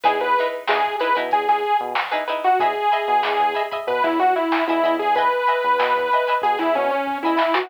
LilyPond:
<<
  \new Staff \with { instrumentName = "Lead 2 (sawtooth)" } { \time 4/4 \key e \mixolydian \tempo 4 = 94 gis'16 b'8 r16 gis'8 b'16 r16 gis'16 gis'8 r4 fis'16 | gis'2 b'16 e'16 fis'16 e'8 e'8 gis'16 | b'2 gis'16 e'16 cis'16 cis'8 e'8 fis'16 | }
  \new Staff \with { instrumentName = "Pizzicato Strings" } { \time 4/4 \key e \mixolydian <dis' e' gis' b'>8 <dis' e' gis' b'>8 <dis' e' gis' b'>8 <dis' e' gis' b'>16 <dis' e' gis' b'>4. <dis' e' gis' b'>16 <dis' e' gis' b'>8 | <dis'' e'' gis'' b''>8 <dis'' e'' gis'' b''>8 <dis'' e'' gis'' b''>8 <dis'' e'' gis'' b''>16 <dis'' e'' gis'' b''>4. <dis'' e'' gis'' b''>16 <dis'' e'' gis'' b''>8 | <dis'' e'' gis'' b''>8 <dis'' e'' gis'' b''>8 <dis'' e'' gis'' b''>8 <dis'' e'' gis'' b''>16 <dis'' e'' gis'' b''>4. <dis'' e'' gis'' b''>16 <dis'' e'' gis'' b''>8 | }
  \new Staff \with { instrumentName = "Synth Bass 1" } { \clef bass \time 4/4 \key e \mixolydian e,16 e,8. e,8. b,16 e,16 e,8 b,4~ b,16 | e,8. b,16 e,16 e,8. b,16 e,16 e,8. e,16 e,8~ | e,8. e,16 b,16 e,8. b,16 e,16 b,8. e,8 e16 | }
  \new DrumStaff \with { instrumentName = "Drums" } \drummode { \time 4/4 <hh bd>16 <hh sn>16 hh16 hh16 sn16 <hh bd>16 hh16 hh16 <hh bd>16 <hh sn>16 hh16 hh16 sn16 hh16 hh16 hh16 | <hh bd>16 hh16 hh16 hh16 sn16 <hh bd>16 hh16 <hh bd>16 <hh bd>16 <hh bd sn>16 hh16 <hh sn>16 sn16 hh16 hh16 hho16 | <hh bd>16 hh16 hh16 hh16 sn16 <hh bd>16 hh16 <hh sn>16 <hh bd>16 <hh sn>16 hh16 hh16 bd8 sn16 sn16 | }
>>